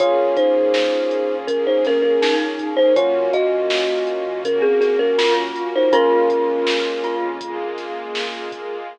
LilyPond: <<
  \new Staff \with { instrumentName = "Kalimba" } { \time 4/4 \key bes \minor \tempo 4 = 81 <f' des''>8 <ees' c''>4. <des' bes'>16 <ees' c''>16 <des' bes'>16 <des' bes'>8 r8 <ees' c''>16 | <f' des''>8 <ges' ees''>4. <des' bes'>16 <c' aes'>16 <c' aes'>16 <des' bes'>8 r8 <ees' c''>16 | <des' bes'>2 r2 | }
  \new Staff \with { instrumentName = "Glockenspiel" } { \time 4/4 \key bes \minor r2. ees'4 | r2. f'4 | f'4. f'4 r4. | }
  \new Staff \with { instrumentName = "Electric Piano 1" } { \time 4/4 \key bes \minor <bes des' f' aes'>1 | <bes des' f' ges'>1 | <aes bes des' f'>1 | }
  \new Staff \with { instrumentName = "Synth Bass 2" } { \clef bass \time 4/4 \key bes \minor bes,,8. bes,4 bes,,16 bes,,16 f,8. bes,,4 | ges,8. ges,4 ges,16 des16 ges,8. ges,4 | bes,,8. bes,,4 f,16 f,16 bes,,8. bes,,4 | }
  \new Staff \with { instrumentName = "String Ensemble 1" } { \time 4/4 \key bes \minor <bes des' f' aes'>2 <bes des' aes' bes'>2 | <bes des' f' ges'>2 <bes des' ges' bes'>2 | <aes bes des' f'>2 <aes bes f' aes'>2 | }
  \new DrumStaff \with { instrumentName = "Drums" } \drummode { \time 4/4 <hh bd>8 <hh bd>8 sn8 hh8 <hh bd>8 <hh sn>8 sn8 <hh bd>8 | <hh bd>8 <hh bd>8 sn8 hh8 <hh bd>8 <hh sn>8 sn8 hh8 | <hh bd>8 <hh bd>8 sn8 hh8 <hh bd>8 <hh sn>8 sn8 <hh bd>8 | }
>>